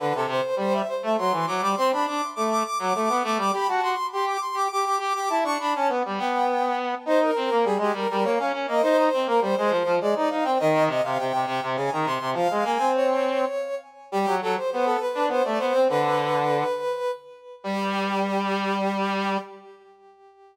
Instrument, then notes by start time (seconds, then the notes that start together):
brass section
0.00 D3 B4
0.15 C3 A4
0.27 C3 C5
0.56 G3 C5
0.73 E5
0.88 C5
1.03 A3 E5
1.17 F#3 C6
1.32 E3
1.47 F#3 D6
1.61 G3 D6
1.77 C4 C6
1.91 D4 B5
2.06 D4 D6
2.35 A3 D6
2.50 D6
2.64 D6
2.79 F#3 D6
2.94 A3 D6
3.09 B3
3.24 A3 D6
3.37 G3 D6
3.53 G4 B5
3.68 F#4 A5
3.81 F#4 C6
4.12 G4 C6
4.26 D6
4.41 C6
4.54 G4 D6
4.71 G4 D6
4.85 G4
4.99 G4 D6
5.15 G4 D6
5.29 E4 A5
5.44 D4 C#6
5.59 D4 B5
5.73 C#4 A5
5.89 B3
6.05 G3
6.18 B3 G5
7.06 D#4 C5
7.21 A#4
7.36 C4
7.51 A#3
7.64 G3 G#4
7.78 G#3 G4
7.93 G3 A#4
8.09 G3 A#4
8.24 A#3 C#5
8.38 C#4 F5
8.53 C#4
8.68 A#3 D#5
8.82 D#4 C5
8.97 C5
9.14 C4
9.26 A#3 A#4
9.41 G3 C5
9.56 G#3 C5
9.69 F3 C5
9.85 F3
10.00 G#3 D5
10.15 D#4 D5
10.30 D#4 F5
10.44 C4 G5
10.59 D#3 D#5
10.87 C3 D#5
11.03 C3 F5
11.18 C3 G5
11.33 C3
11.46 C3
11.63 C3
11.76 C#3 G#5
11.91 D#3 A#5
12.05 C3 C6
12.21 C3
12.33 F3 F5
12.50 G#3
12.64 A#3 G#5
12.78 C4
12.95 C#5
14.12 G3 G4
14.27 F#3
14.41 F#3 A4
14.56 C5
14.71 B3 C5
14.85 A4
15.00 B4
15.15 D4
15.28 B3 C5
15.44 A3 D5
15.59 B3 C5
15.74 C4
15.88 D3 B4
17.64 G3 G4